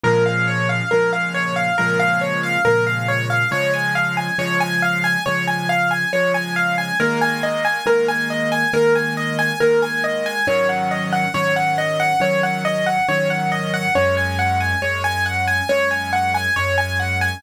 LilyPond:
<<
  \new Staff \with { instrumentName = "Acoustic Grand Piano" } { \time 4/4 \key des \major \tempo 4 = 69 bes'16 f''16 des''16 f''16 bes'16 f''16 des''16 f''16 bes'16 f''16 des''16 f''16 bes'16 f''16 des''16 f''16 | des''16 aes''16 f''16 aes''16 des''16 aes''16 f''16 aes''16 des''16 aes''16 f''16 aes''16 des''16 aes''16 f''16 aes''16 | bes'16 aes''16 ees''16 aes''16 bes'16 aes''16 ees''16 aes''16 bes'16 aes''16 ees''16 aes''16 bes'16 aes''16 ees''16 aes''16 | des''16 ges''16 ees''16 ges''16 des''16 ges''16 ees''16 ges''16 des''16 ges''16 ees''16 ges''16 des''16 ges''16 ees''16 ges''16 |
des''16 aes''16 ges''16 aes''16 des''16 aes''16 ges''16 aes''16 des''16 aes''16 ges''16 aes''16 des''16 aes''16 ges''16 aes''16 | }
  \new Staff \with { instrumentName = "Acoustic Grand Piano" } { \time 4/4 \key des \major <bes, des f aes>4 <bes, des f aes>4 <bes, des f aes>4 <bes, des f aes>4 | <des f aes>4 <des f aes>4 <des f aes>4 <des f aes>4 | <ees aes bes>4 <ees aes bes>4 <ees aes bes>4 <ees aes bes>4 | <aes, ees ges des'>4 <aes, ees ges des'>4 <aes, ees ges des'>4 <aes, ees ges des'>4 |
<ges, aes des'>4 <ges, aes des'>4 <ges, aes des'>4 <ges, aes des'>4 | }
>>